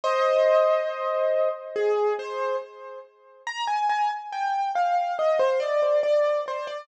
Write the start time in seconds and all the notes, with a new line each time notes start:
0.04 C5 D#5
1.76 G#4
2.19 C5
3.47 A#5
3.68 G#5
3.89 G#5
4.33 G5
4.75 F5
5.19 D#5
5.39 C5
5.60 D5
6.03 D5
6.48 C5
6.67 D5